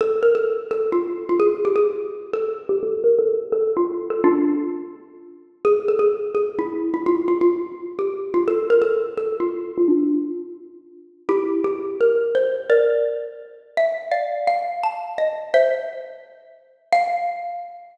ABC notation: X:1
M:4/4
L:1/8
Q:"Swing" 1/4=170
K:F
V:1 name="Xylophone"
A B A2 A F2 F | _A G A2 z =A2 G | A B A2 A F2 A | [DF]6 z2 |
_A =A _A2 A E2 E | F F F2 z G2 F | A B A2 A F2 F | [DF]6 z2 |
[EG]2 G2 B2 c2 | [Bd]6 e2 | [df]2 f2 a2 _e2 | [ce]5 z3 |
f8 |]